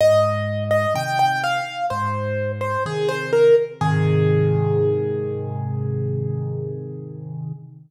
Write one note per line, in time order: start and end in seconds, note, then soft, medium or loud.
0.01 0.86 G#2 medium
0.01 0.64 D#5 loud
0.71 0.93 D#5 medium
0.94 1.61 C3 medium
0.94 1.61 D#3 medium
0.94 1.18 G5 loud
1.19 1.42 G5 medium
1.44 1.86 F5 medium
1.90 2.77 G#2 medium
1.90 2.52 C5 medium
2.61 2.84 C5 medium
2.86 3.52 C3 medium
2.86 3.52 D#3 medium
2.86 3.09 G#4 loud
3.09 3.31 C5 medium
3.33 3.55 A#4 medium
3.81 7.52 G#2 loud
3.81 7.52 C3 loud
3.81 7.52 D#3 loud
3.81 7.52 G#4 loud